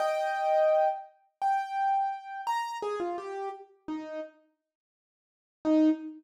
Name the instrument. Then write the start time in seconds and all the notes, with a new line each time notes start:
acoustic grand piano
0.00 D#5 G5
1.42 G5
2.47 A#5
2.82 G#4
3.00 F4
3.18 G4
3.88 D#4
5.65 D#4